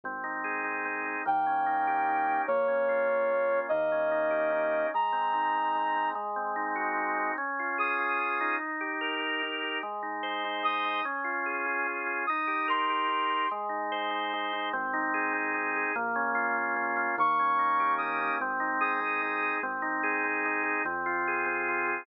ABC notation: X:1
M:3/4
L:1/8
Q:1/4=147
K:Ab
V:1 name="Brass Section"
z6 | g6 | d6 | e6 |
b6 | z6 | z2 e'4 | z6 |
z4 e'2 | z6 | e'2 c'4 | z6 |
z6 | z6 | d'4 e'2 | z2 e'4 |
z6 | z6 |]
V:2 name="Drawbar Organ"
C E A E C E | B, D E G E D | B, D F D B, D | B, D E G E D |
A, C E C A, C | A, C E _G E C | D F A F D E- | E G B G E G |
A, E c E A, E | D F A F D F | E G B G E G | A, E c E A, E |
C E A C E A | B, D F B, D F | B, D E G B, D | C E A C E A |
C E A C E A | C F A C F A |]
V:3 name="Synth Bass 1" clef=bass
A,,,6 | E,,6 | B,,,6 | E,,6 |
z6 | z6 | z6 | z6 |
z6 | z6 | z6 | z6 |
A,,,6 | B,,,6 | E,,6 | A,,,6 |
A,,,6 | F,,6 |]